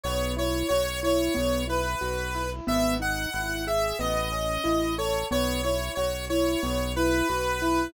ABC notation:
X:1
M:4/4
L:1/8
Q:1/4=91
K:E
V:1 name="Lead 1 (square)"
c c c c2 B3 | e f2 e d3 c | c c c c2 B3 |]
V:2 name="Acoustic Grand Piano"
B, E F E B, E F E | B, D E G B, C E A | B, E F E B, E F E |]
V:3 name="Synth Bass 1" clef=bass
B,,,2 B,,,2 B,,,2 B,,,2 | G,,,2 G,,,2 A,,,2 A,,,2 | B,,,2 B,,,2 B,,,2 B,,,2 |]